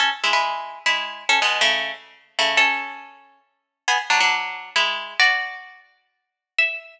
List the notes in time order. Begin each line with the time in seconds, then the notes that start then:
0.00 C#4 A4
0.24 G#3 E4
0.33 G#3 E4
0.86 G#3 E4
1.29 C#4 A4
1.42 B2 G#3
1.61 C#3 A3
2.39 C#3 A3
2.57 C#4 A4
3.88 B3 G#4
4.10 F#3 D4
4.20 F#3 D4
4.76 G#3 E4
5.20 F#4 D5
6.59 E5